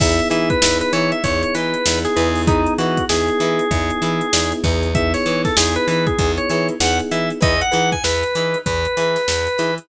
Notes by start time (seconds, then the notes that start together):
0.00 E2 B3 D#4 E4 G#4 B4 E5, kick, crash
0.19 closed hi-hat
0.30 E3 D#4 E4 G#4 B4 E5, closed hi-hat
0.50 B4, kick, closed hi-hat
0.62 E2 B3 D#4 E4 G#4, snare
0.81 B4, closed hi-hat
0.93 E3 D#4 E4 G#4 B4 C#5, snare, closed hi-hat
1.12 E5, closed hi-hat
1.24 E2 B3 D#4 E4 G#4 C#5, kick, closed hi-hat
1.43 C#5, closed hi-hat
1.55 E3 D#4 E4 G#4 B4, closed hi-hat
1.74 closed hi-hat
1.86 E2 B3 D#4 E4 G#4, snare
2.05 G#4, snare, closed hi-hat
2.16 E2 B3 D#4 E4 G#4 B4, closed hi-hat
2.35 open hi-hat
2.47 D#4 E4 G#4 B4, kick, closed hi-hat
2.66 closed hi-hat
2.78 E3 D#4 E4 F#4 G#4 B4, closed hi-hat
2.97 kick, closed hi-hat
3.09 E2 B3 D#4 E4 G#4, snare
3.28 closed hi-hat
3.40 E3 D#4 E4 G#4 B4, closed hi-hat
3.59 closed hi-hat
3.71 E2 B3 D#4 E4 G#4, kick, closed hi-hat
3.90 closed hi-hat
4.02 E3 D#4 E4 G#4 B4, closed hi-hat
4.21 closed hi-hat
4.33 E2 B3 D#4 E4 G#4, snare
4.52 closed hi-hat
4.64 E2 D#4 E4 G#4 B4, kick, closed hi-hat
4.83 closed hi-hat
4.95 B3 D#4 E4 G#4 E5, kick, closed hi-hat
5.14 C#5, snare, closed hi-hat
5.26 E3 D#4 E4 G#4 B4, closed hi-hat
5.45 A4, kick, snare, closed hi-hat
5.56 E2 B3 D#4 E4 G#4, snare
5.76 B4, closed hi-hat
5.88 E3 D#4 E4 G#4 B4, closed hi-hat
6.07 G#4, kick, closed hi-hat
6.18 E2 B3 D#4 E4 G#4, kick, closed hi-hat
6.38 C#5, closed hi-hat
6.49 E3 D#4 E4 G#4 B4 C#5, closed hi-hat
6.69 closed hi-hat
6.80 E2 B3 D#4 E4 G#4 F#5, snare
6.99 closed hi-hat
7.11 E3 D#4 E4 G#4 B4 E5, closed hi-hat
7.30 closed hi-hat
7.41 E2 D#4 E4 G#4 B4 D#5, kick, closed hi-hat
7.61 F#5, closed hi-hat
7.71 E3 D#4 E4 G#4 B4, closed hi-hat
7.92 G#5, kick, closed hi-hat
8.04 E2 B4, snare
8.23 closed hi-hat
8.35 E3 D#4 E4 G#4 B4, closed hi-hat
8.54 closed hi-hat
8.66 E2 B4, kick, closed hi-hat
8.85 closed hi-hat
8.97 E3 D#4 E4 G#4 B4, closed hi-hat
9.16 snare, closed hi-hat
9.28 E2, snare
9.47 closed hi-hat
9.58 E3 D#4 E4 G#4 B4, closed hi-hat
9.78 closed hi-hat